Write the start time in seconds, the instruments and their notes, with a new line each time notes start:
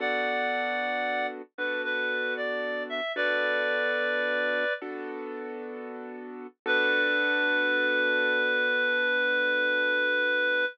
0.00 acoustic grand piano B3 D4 F#4 A4, clarinet D5 F#5
1.58 acoustic grand piano B3 D4 F#4 A4, clarinet B4
1.84 clarinet B4
2.37 clarinet D5
2.89 clarinet E5
3.16 acoustic grand piano B3 D4 F#4 A4, clarinet B4 D5
4.82 acoustic grand piano B3 D4 F#4 A4
6.66 acoustic grand piano B3 D4 F#4 A4, clarinet B4